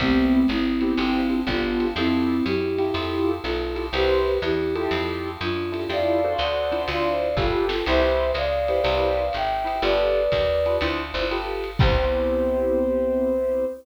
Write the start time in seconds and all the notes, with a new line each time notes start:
0.00 C2 A3 B3 C4 E4 G4, kick, ride
0.48 G#1 C4 E4, hi-hat pedal, ride
0.81 B3 C4 E4 G4, ride
0.97 G1 C4 D4 F4 G4, ride
1.30 C4 D4 F4 G4
1.47 G1 B3 D4 F4 G4 A4, kick, hi-hat pedal, ride
1.80 ride
1.96 F2 C4 E4 F4 G4 A4, ride
2.45 F#2 E4 G4, hi-hat pedal, ride
2.78 E4 F4 G4 A4, ride
2.94 F2 E4 F4 G4 A4, ride
3.43 B1 F4 A4, hi-hat pedal, ride
3.75 E4 F4 G4 A4, ride
3.93 C2 E4 G4 B4 C5, ride
4.42 E2 E4 G4, hi-hat pedal, ride
4.76 E4 F4 G4 A4, ride
4.91 F2, ride
5.41 F#2 D4 F4, hi-hat pedal, ride
5.72 E4 F4 G4 A4, ride
5.89 F2 E4 F4 G4 A4 D5 F5, ride
6.24 D4 F#4 A4 C5
6.38 D2 D5 F#5, hi-hat pedal, ride
6.72 D4 E4 F4 C5, ride
6.88 D2 D5 F5, ride
7.37 G1 F4 G4 A4 B4, kick, snare
7.69 F4 A4, snare
7.86 C2 E4 G4 B4 C5 E5, crash, ride
8.34 C#2 D5 F5, hi-hat pedal, ride
8.68 E4 G4 B4 C5, ride
8.84 C2 E4 G4 B4 C5, ride
9.33 G#1 E5 G5, hi-hat pedal, ride
9.65 E4 G4 B4 C5, ride
9.82 G1 F4 G4 A4 B4 D5, ride
10.32 D#2, kick, hi-hat pedal, ride
10.66 F4 G4 A4 B4, ride
10.81 D2 D4 E4 F4 C5, ride
11.14 G1 D4 E4 F4 C5
11.30 F4 G4 A4 B4, hi-hat pedal, ride
11.64 ride
11.79 C2 B3 C4 E4 G4 C5, kick, crash